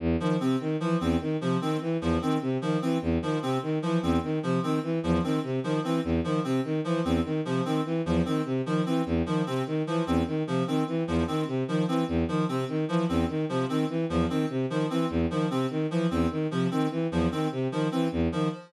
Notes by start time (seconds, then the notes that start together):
0.00 E2
0.20 D#3 F3
0.40 C3 C4
0.60 D#3
0.80 E3 F3
1.01 E2 C4
1.21 D#3
1.41 C3 F3
1.61 D#3 C4
1.81 E3
2.01 E2 F3
2.22 D#3 C4
2.42 C3
2.61 D#3 F3
2.82 E3 C4
3.02 E2
3.22 D#3 F3
3.42 C3 C4
3.63 D#3
3.82 E3 F3
4.03 E2 C4
4.23 D#3
4.43 C3 F3
4.63 D#3 C4
4.83 E3
5.03 E2 F3
5.23 D#3 C4
5.43 C3
5.64 D#3 F3
5.84 E3 C4
6.04 E2
6.24 D#3 F3
6.44 C3 C4
6.64 D#3
6.84 E3 F3
7.05 E2 C4
7.25 D#3
7.45 C3 F3
7.65 D#3 C4
7.85 E3
8.06 E2 F3
8.25 D#3 C4
8.45 C3
8.66 D#3 F3
8.86 E3 C4
9.06 E2
9.26 D#3 F3
9.46 C3 C4
9.67 D#3
9.87 E3 F3
10.07 E2 C4
10.27 D#3
10.47 C3 F3
10.67 D#3 C4
10.87 E3
11.07 E2 F3
11.27 D#3 C4
11.47 C3
11.68 D#3 F3
11.88 E3 C4
12.08 E2
12.28 D#3 F3
12.48 C3 C4
12.69 D#3
12.88 E3 F3
13.09 E2 C4
13.29 D#3
13.49 C3 F3
13.69 D#3 C4
13.89 E3
14.09 E2 F3
14.29 D#3 C4
14.50 C3
14.70 D#3 F3
14.90 E3 C4
15.10 E2
15.30 D#3 F3
15.50 C3 C4
15.70 D#3
15.91 E3 F3
16.11 E2 C4
16.31 D#3
16.51 C3 F3
16.71 D#3 C4
16.91 E3
17.11 E2 F3
17.31 D#3 C4
17.52 C3
17.72 D#3 F3
17.92 E3 C4
18.12 E2
18.32 D#3 F3